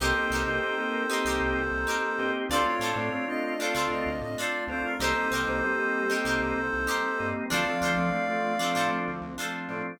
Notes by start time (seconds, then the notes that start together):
0.00 C2 A#3 C4 D#4 G4 A4 A#4 C5
0.15 A#3 C4 D#4 G4
0.30 C2 D#4 G4 A#4
0.35 C5
0.46 C2 A#3 C4 D#4 G4
0.62 A#3 C4 D#4 G4
0.78 A#3 C4 D#4 G4
1.09 A#3 C4 D#4 G4 A#4 C5
1.25 C2 D#4 G4 A#4
1.29 C5
1.40 C2
1.56 C2
1.71 C2
1.87 D#4 G4 A#4 C5
2.18 G2 A#3 C4 D#4 G4
2.49 D2 A3 C4 D4 F4 A4 D5
2.54 C5
2.66 A3 C4 D4 F4 C#5
2.79 A2 D4 F4 A4
2.85 C5
2.96 A2 A3 C4 D4 F4
3.12 A3 C4 D4 F4
3.28 A3 C4 D4 F4 D#5
3.43 D#5
3.59 A3 C4 D4 F4 A4 F5
3.63 C5
3.74 D2 D4 F4 A4 C5
3.90 D2 D#5
4.06 D2
4.21 A2 D#5
4.37 D4 F4 A4 D5
4.42 C5
4.67 D2 A3 C4 D4 F4 C5
4.84 A#4
4.99 C2 G3 A#3 C4 D#4 G4 A4 A#4 C5
5.04 C5
5.15 G3 A#3 C4 D#4
5.31 C2 D#4 G4 A#4
5.35 C5
5.47 C2 G3 A#3 C4 D#4 C5
5.62 G3 A#3 C4 D#4 G4
5.78 G3 A#3 C4 D#4
6.09 G3 A#3 C4 D#4 G4 A#4
6.13 C5
6.24 C2 D#4 G4 A#4
6.29 C5
6.39 C2
6.56 C2
6.73 C2
6.87 D#4 G4 A#4 C5
7.19 G2 G3 A#3 C4 D#4
7.50 D2 F3 A3 C4 D4 F4 A4 D5 F5
7.54 C5
7.66 F3 A3 C4 D4
7.81 D2 D4 F4 A4
7.85 C5
7.97 D2 F3 A3 C4 D4
8.12 F3 A3 C4 D4
8.28 F3 A3 C4 D4
8.59 F3 A3 C4 D4 F4 A4 C5
8.75 A2 D4 F4 A4 C5
8.91 D2
9.08 D2
9.22 D2
9.38 D4 F4 A4 C5
9.68 A2 F3 A3 C4 D4